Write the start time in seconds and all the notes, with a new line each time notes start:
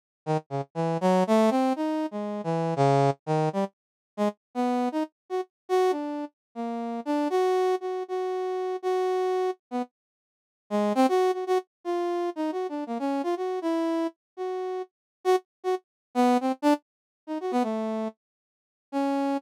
0.26 D#3
0.50 C#3
0.75 E3
1.01 F#3
1.27 A3
1.50 C4
1.76 D#4
2.11 G#3
2.44 E3
2.76 C#3
3.26 D#3
3.53 G3
4.17 G#3
4.55 B3
4.92 D#4
5.30 F#4
5.69 F#4
5.91 D4
6.55 A#3
7.05 D4
7.30 F#4
7.81 F#4
8.08 F#4
8.82 F#4
9.71 B3
10.70 G#3
10.95 C4
11.09 F#4
11.33 F#4
11.47 F#4
11.84 F4
12.36 D#4
12.52 F#4
12.69 D4
12.87 A#3
12.99 C#4
13.23 F4
13.37 F#4
13.62 E4
14.37 F#4
15.24 F#4
15.64 F#4
16.15 B3
16.41 C4
16.62 D4
17.27 D#4
17.41 F#4
17.51 B3
17.63 A3
18.92 C#4